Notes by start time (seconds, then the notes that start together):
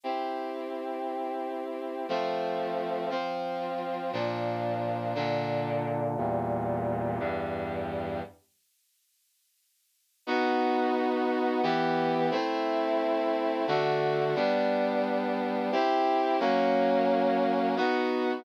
0.04 C4 E4 G4
2.09 F3 A3 C4
3.10 F3 C4 F4
4.13 A#2 F3 D4
5.15 A#2 D3 D4
6.17 E2 A#2 G3
7.19 E2 G2 G3
10.27 B3 D#4 F#4
11.63 E3 B3 G4
12.31 A3 C4 E4
13.67 D3 A3 F#4
14.36 G3 B3 D4
15.72 C4 E4 G4
16.40 F#3 A#3 C#4
17.77 B3 D#4 F#4